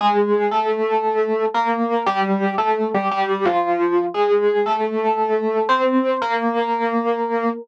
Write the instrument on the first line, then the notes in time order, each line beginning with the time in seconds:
electric piano 1
0.01 G#3 G#4
0.51 A3 A4
1.54 A#3 A#4
2.06 G3 G4
2.58 A3 A4
2.94 G3 G4
3.11 G3 G4
3.45 F3 F4
4.14 G#3 G#4
4.66 A3 A4
5.69 C4 C5
6.22 A#3 A#4